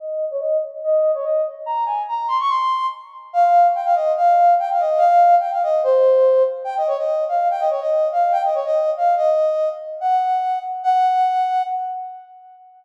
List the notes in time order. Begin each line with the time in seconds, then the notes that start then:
0.00 D#5
0.31 C#5
0.40 D#5
0.84 D#5
1.14 C#5
1.24 D#5
1.66 A#5
1.86 G#5
2.08 A#5
2.28 C6
2.40 C#6
2.49 C6
3.33 F5
3.75 G5
3.85 F5
3.95 D#5
4.16 F5
4.59 G5
4.71 F5
4.80 D#5
4.98 F5
5.40 G5
5.53 F5
5.63 D#5
5.84 C5
6.64 G5
6.77 D#5
6.87 C#5
6.98 D#5
7.29 F5
7.51 G5
7.60 D#5
7.70 C#5
7.81 D#5
8.12 F5
8.32 G5
8.44 D#5
8.55 C#5
8.65 D#5
8.97 F5
9.16 D#5
10.01 F#5
10.83 F#5